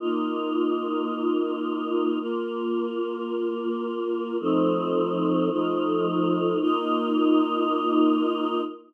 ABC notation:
X:1
M:12/8
L:1/8
Q:3/8=109
K:Bb
V:1 name="Choir Aahs"
[B,EF]12 | [B,FB]12 | [F,A,CE]6 [F,A,EF]6 | [B,EF]12 |]